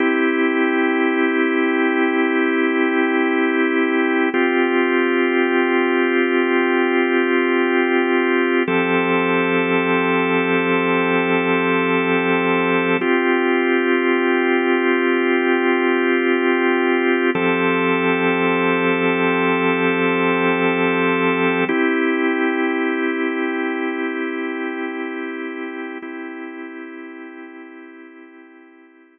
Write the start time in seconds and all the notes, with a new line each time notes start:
0.00 C4 E4 G4
4.34 C4 F4 G4
8.68 F3 C4 G4 A4
13.01 C4 F4 G4
17.35 F3 C4 G4 A4
21.69 C4 E4 G4
26.02 C4 E4 G4